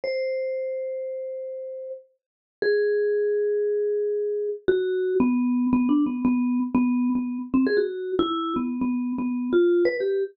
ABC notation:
X:1
M:5/4
L:1/16
Q:1/4=116
K:none
V:1 name="Vibraphone"
c16 z4 | _A16 _G4 | B,4 (3B,2 D2 B,2 B,3 z B,3 B,2 z C _A | _G3 E3 B,2 (3B,4 B,4 F4 B =G2 z |]